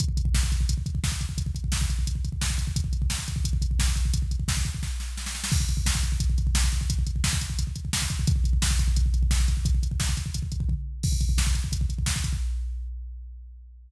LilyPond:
\new DrumStaff \drummode { \time 4/4 \tempo 4 = 174 <hh bd>16 bd16 <hh bd>16 bd16 <bd sn>16 bd16 <hh bd>16 bd16 <hh bd>16 bd16 <hh bd>16 bd16 <bd sn>16 bd16 <hh bd>16 bd16 | <hh bd>16 bd16 <hh bd>16 bd16 <bd sn>16 bd16 <hh bd>16 bd16 <hh bd>16 bd16 <hh bd>16 bd16 <bd sn>16 bd16 <hh bd>16 bd16 | <hh bd>16 bd16 <hh bd>16 bd16 <bd sn>16 bd16 <hh bd>16 bd16 <hh bd>16 bd16 <hh bd>16 bd16 <bd sn>16 bd16 <hh bd>16 bd16 | <hh bd>16 bd16 <hh bd>16 bd16 <bd sn>16 bd16 <hh bd>16 bd16 <bd sn>8 sn8 sn16 sn16 sn16 sn16 |
<cymc bd>16 bd16 <hh bd>16 bd16 <bd sn>16 bd16 <hh bd>16 bd16 <hh bd>16 bd16 <hh bd>16 bd16 <bd sn>16 bd16 <hh bd>16 bd16 | <hh bd>16 bd16 <hh bd>16 bd16 <bd sn>16 bd16 <hh bd>16 bd16 <hh bd>16 bd16 <hh bd>16 bd16 <bd sn>16 bd16 <hh bd>16 bd16 | <hh bd>16 bd16 <hh bd>16 bd16 <bd sn>16 bd16 <hh bd>16 bd16 <hh bd>16 bd16 <hh bd>16 bd16 <bd sn>16 bd16 <hh bd>16 bd16 | <hh bd>16 bd16 <hh bd>16 bd16 <hh bd sn>16 bd16 <hh bd>16 bd16 <hh bd>16 bd16 <hh bd>16 bd16 <bd tomfh>4 |
<cymc bd>16 bd16 <hh bd>16 bd16 <bd sn>16 bd16 <hh bd>16 bd16 <hh bd>16 bd16 <hh bd>16 bd16 <bd sn>16 bd16 <hh bd>16 bd16 | }